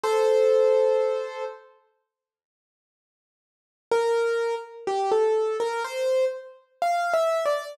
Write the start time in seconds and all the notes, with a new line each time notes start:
0.03 A4 C5
3.92 A#4
4.87 G4
5.11 A4
5.60 A#4
5.84 C5
6.82 F5
7.14 E5
7.46 D5